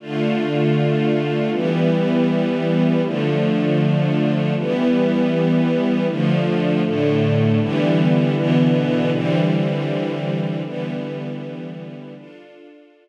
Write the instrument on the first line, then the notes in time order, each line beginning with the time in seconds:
string ensemble 1
0.00 D3 A3 F4
1.51 E3 G3 B3
3.03 D3 F3 A3
4.56 E3 G3 B3
6.08 D3 F3 A3
6.84 A2 D3 A3
7.59 D3 E3 G3 B3
8.36 B2 D3 E3 B3
9.12 D3 E3 G3 C4
10.64 D3 E3 G3 B3
12.15 D4 F4 A4